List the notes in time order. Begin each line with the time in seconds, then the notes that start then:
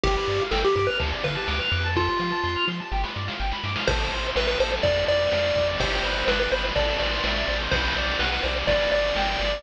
0.04 G1 G4, kick, ride
0.16 B4
0.28 G2 D5, ride
0.40 F5
0.51 G1 A4 G5, snare
0.64 G4 B5
0.76 G2 G4 D6, kick, ride
0.87 B4 F6
0.99 D2 A4, kick, ride
1.12 D5
1.24 D3 B4 F5, kick, ride
1.35 A5
1.48 D2 D6, snare
1.60 F6
1.72 F2 D6, ride
1.84 A5
1.96 F4 A4, kick, snare
2.08 C5
2.19 F3 F5, snare
2.32 A5
2.44 F2 C6, snare
2.56 F6
2.68 F3 C6, snare
2.80 A5
2.92 G1 G4, snare
3.03 B4, snare
3.16 G2 D5, snare
3.28 F5, snare
3.40 G1 G5, snare
3.52 B5, snare
3.64 G2 D6, snare
3.75 F6, snare
3.87 A1 A4 C5, kick, crash
4.00 ride
4.12 A1 C5, ride
4.24 ride
4.36 A1 B4 E5, snare
4.47 B4, ride
4.60 A1 A4 C5, ride
4.72 ride
4.83 F2 D5, kick, ride
4.96 ride
5.08 F2 D5, ride
5.20 ride
5.32 F2 F5, snare
5.44 ride
5.55 F2 D5, kick, ride
5.68 ride
5.79 G1 G4 C5, kick, ride
5.92 ride
6.03 G1 B4, ride
6.16 ride
6.27 G1 B4 D5, snare
6.40 B4, ride
6.52 G1 B4 C5, ride
6.64 ride
6.76 A1 A4 D5, kick, ride
6.88 ride
6.99 A1 C5 D5, ride
7.12 ride
7.24 A1 E5, snare
7.36 ride
7.48 A1 C5, ride
7.60 ride
7.71 B1 B4 C5, kick, ride
7.84 ride
7.96 B1 D5, ride
8.08 ride
8.19 B1 B4 F#5, snare
8.32 B4, ride
8.43 B1 C5 D5, ride
8.56 ride
8.67 G1 B4 D5, kick, ride
8.80 ride
8.92 G1 D5, ride
9.04 ride
9.15 G1 G5, snare
9.28 ride
9.39 G1 D5, ride
9.52 ride